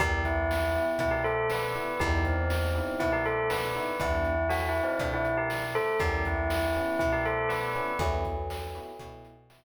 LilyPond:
<<
  \new Staff \with { instrumentName = "Tubular Bells" } { \time 4/4 \key e \minor \tempo 4 = 120 <g g'>8 <e e'>4. <e e'>16 <g g'>16 <a a'>8 <b b'>4 | <g g'>8 <c c'>4. <e e'>16 <g g'>16 <a a'>8 <b b'>4 | <e e'>4 \tuplet 3/2 { <fis fis'>8 <e e'>8 <c c'>8 } <d d'>16 <e e'>8 <g g'>16 r8 <a a'>8 | <g g'>8 <e e'>4. <e e'>16 <g g'>16 <a a'>8 <b b'>4 |
<fis, fis>2. r4 | }
  \new Staff \with { instrumentName = "Electric Piano 1" } { \time 4/4 \key e \minor <b e' g'>4. <b e' g'>2 <b e' g'>8 | <b dis' e' g'>4. <b dis' e' g'>2 <b dis' e' g'>8 | <b d' e' g'>1 | <b cis' e' g'>4. <b cis' e' g'>2 <b cis' e' g'>8 |
<b e' fis' g'>4. <b e' fis' g'>8 <b e' fis' g'>4 <b e' fis' g'>8 r8 | }
  \new Staff \with { instrumentName = "Electric Bass (finger)" } { \clef bass \time 4/4 \key e \minor e,2 b,2 | e,2 b,2 | e,2 b,2 | e,2 b,2 |
e,2 b,2 | }
  \new DrumStaff \with { instrumentName = "Drums" } \drummode { \time 4/4 <hh bd>8 <hh bd>8 sn8 hh8 <hh bd>8 hh8 sn8 hh8 | <hh bd>8 <hh bd>8 sn8 hh8 <hh bd>8 hh8 sn8 hh8 | <hh bd>8 hh8 sn8 hh8 <hh bd>8 hh8 sn8 hh8 | <hh bd>8 <hh bd>8 sn8 hh8 <hh bd>8 hh8 sn8 hh8 |
<hh bd>8 <hh bd>8 sn8 hh8 <hh bd>8 hh8 sn4 | }
>>